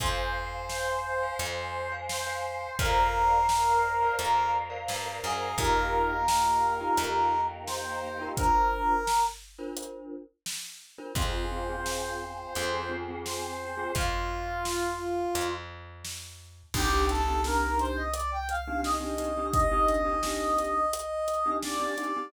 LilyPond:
<<
  \new Staff \with { instrumentName = "Brass Section" } { \time 4/4 \key f \dorian \tempo 4 = 86 c''2. c''4 | bes'2 bes'8 r4 aes'8 | bes'2. c''4 | bes'4. r2 r8 |
c''2. c''4 | f'2~ f'8 r4. | \key c \dorian g'8 a'8 bes'8 c''16 ees''16 d''16 g''16 f''8 ees''4 | ees''2. d''4 | }
  \new Staff \with { instrumentName = "Glockenspiel" } { \time 4/4 \key f \dorian <c'' f'' aes''>4.~ <c'' f'' aes''>16 <c'' f'' aes''>4 <c'' f'' aes''>8 <c'' f'' aes''>8. | <bes' c'' d'' f''>4.~ <bes' c'' d'' f''>16 <bes' c'' d'' f''>4 <bes' c'' d'' f''>8 <bes' c'' d'' f''>8. | <ees' f' g' bes'>4.~ <ees' f' g' bes'>16 <ees' f' g' bes'>2 <ees' f' g' bes'>16 | <d' f' bes' c''>4.~ <d' f' bes' c''>16 <d' f' bes' c''>2 <d' f' bes' c''>16 |
<c' f' aes'>8 <c' f' aes'>16 <c' f' aes'>4~ <c' f' aes'>16 <c' f' aes'>16 <c' f' aes'>16 <c' f' aes'>16 <c' f' aes'>4 <c' f' aes'>16 | r1 | \key c \dorian <c' d' ees' g'>16 <c' d' ees' g'>8 <c' d' ees' g'>16 <c' d' ees' g'>4.~ <c' d' ees' g'>16 <c' d' ees' g'>16 <c' d' ees' g'>16 <c' d' ees' g'>16 <c' d' ees' g'>16 <c' d' ees' g'>16~ | <c' d' ees' g'>16 <c' d' ees' g'>8 <c' d' ees' g'>16 <c' d' ees' g'>4.~ <c' d' ees' g'>16 <c' d' ees' g'>16 <c' d' ees' g'>16 <c' d' ees' g'>16 <c' d' ees' g'>16 <c' d' ees' g'>16 | }
  \new Staff \with { instrumentName = "Electric Bass (finger)" } { \clef bass \time 4/4 \key f \dorian f,2 f,2 | f,2 f,4 g,8 ges,8 | f,2 f,2 | r1 |
f,2 f,2 | f,2 f,2 | \key c \dorian c,1~ | c,1 | }
  \new Staff \with { instrumentName = "Choir Aahs" } { \time 4/4 \key f \dorian <c'' f'' aes''>2 <c'' aes'' c'''>2 | <bes' c'' d'' f''>2 <bes' c'' f'' bes''>2 | <bes ees' f' g'>2 <bes ees' g' bes'>2 | r1 |
<c' f' aes'>2 <c' aes' c''>2 | r1 | \key c \dorian r1 | r1 | }
  \new DrumStaff \with { instrumentName = "Drums" } \drummode { \time 4/4 <hh bd>4 sn4 hh4 sn4 | <hh bd>4 sn4 hh4 sn4 | <hh bd>4 sn4 hh4 sn4 | <hh bd>4 sn4 hh4 sn4 |
<hh bd>4 sn4 hh4 sn4 | <hh bd>4 sn4 hh4 sn4 | <cymc bd>8 hh8 sn8 hh8 hh8 hh8 sn8 hh8 | <hh bd>8 hh8 sn8 hh8 hh8 hh8 sn8 hh8 | }
>>